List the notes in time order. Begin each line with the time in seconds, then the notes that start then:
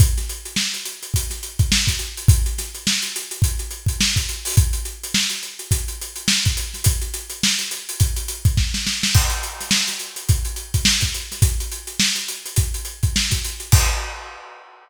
0.00 kick, closed hi-hat
0.18 snare, closed hi-hat
0.29 closed hi-hat
0.45 closed hi-hat
0.56 snare
0.74 closed hi-hat
0.85 closed hi-hat
1.03 closed hi-hat
1.14 kick, closed hi-hat
1.30 snare, closed hi-hat
1.43 closed hi-hat
1.59 kick, closed hi-hat
1.72 snare
1.87 kick, snare, closed hi-hat
1.99 closed hi-hat
2.17 closed hi-hat
2.28 kick, closed hi-hat
2.46 closed hi-hat
2.58 snare, closed hi-hat
2.75 closed hi-hat
2.87 snare
3.02 closed hi-hat
3.16 closed hi-hat
3.31 closed hi-hat
3.42 kick, closed hi-hat
3.59 closed hi-hat
3.71 closed hi-hat
3.86 kick, closed hi-hat
4.00 snare
4.16 kick, snare, closed hi-hat
4.29 closed hi-hat
4.45 open hi-hat
4.57 kick, closed hi-hat
4.73 closed hi-hat
4.85 closed hi-hat
5.03 closed hi-hat
5.14 snare
5.30 closed hi-hat
5.43 closed hi-hat
5.59 closed hi-hat
5.71 kick, closed hi-hat
5.88 closed hi-hat
6.01 closed hi-hat
6.16 closed hi-hat
6.28 snare
6.45 kick, snare, closed hi-hat
6.57 closed hi-hat
6.74 snare, closed hi-hat
6.84 kick, closed hi-hat
7.01 closed hi-hat
7.14 closed hi-hat
7.30 closed hi-hat
7.43 snare
7.59 closed hi-hat
7.71 closed hi-hat
7.89 closed hi-hat
8.00 kick, closed hi-hat
8.16 closed hi-hat
8.28 closed hi-hat
8.45 kick, closed hi-hat
8.57 kick, snare
8.74 snare
8.87 snare
9.03 snare
9.15 kick, crash
9.30 closed hi-hat
9.43 closed hi-hat
9.61 snare, closed hi-hat
9.71 snare
9.88 snare, closed hi-hat
9.99 closed hi-hat
10.16 closed hi-hat
10.29 kick, closed hi-hat
10.45 closed hi-hat
10.56 closed hi-hat
10.74 kick, closed hi-hat
10.85 snare
11.01 kick, snare, closed hi-hat
11.14 closed hi-hat
11.32 snare, closed hi-hat
11.42 kick, closed hi-hat
11.60 closed hi-hat
11.72 closed hi-hat
11.87 closed hi-hat
12.00 snare
12.15 closed hi-hat
12.28 closed hi-hat
12.46 closed hi-hat
12.56 kick, closed hi-hat
12.74 closed hi-hat
12.85 closed hi-hat
13.03 kick, closed hi-hat
13.16 snare
13.31 kick, snare, closed hi-hat
13.44 closed hi-hat
13.60 closed hi-hat
13.72 kick, crash